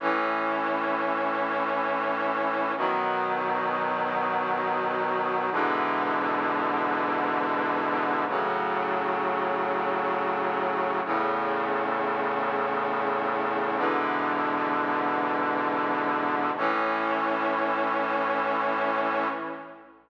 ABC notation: X:1
M:4/4
L:1/8
Q:1/4=87
K:A
V:1 name="Brass Section"
[A,,E,C]8 | [B,,^D,F,]8 | [G,,B,,D,E,]8 | [A,,C,F,]8 |
[E,,A,,C,]8 | [G,,B,,D,E,]8 | [A,,E,C]8 |]